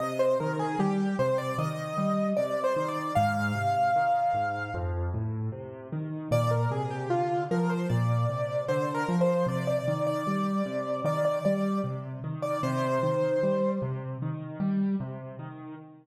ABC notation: X:1
M:4/4
L:1/16
Q:1/4=76
K:Cm
V:1 name="Acoustic Grand Piano"
e c B A G2 c d e4 (3d2 c2 d2 | f10 z6 | d B A G F2 B c d4 (3c2 B2 c2 | d d2 d5 d d d2 z3 d |
c6 z10 |]
V:2 name="Acoustic Grand Piano" clef=bass
C,2 E,2 G,2 C,2 E,2 G,2 C,2 E,2 | A,,2 C,2 E,2 A,,2 F,,2 =A,,2 C,2 E,2 | B,,2 C,2 D,2 F,2 B,,2 C,2 D,2 F,2 | C,2 E,2 G,2 C,2 E,2 G,2 C,2 E,2 |
C,2 E,2 G,2 C,2 E,2 G,2 C,2 E,2 |]